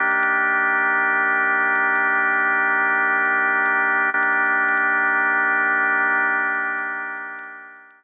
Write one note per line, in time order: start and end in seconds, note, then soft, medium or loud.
0.00 4.10 D#3 loud
0.00 4.10 A#3 loud
0.00 4.10 D4 medium
0.00 4.10 G4 medium
4.14 8.04 D#3 loud
4.14 8.04 A#3 loud
4.14 8.04 D4 loud
4.14 8.04 G4 medium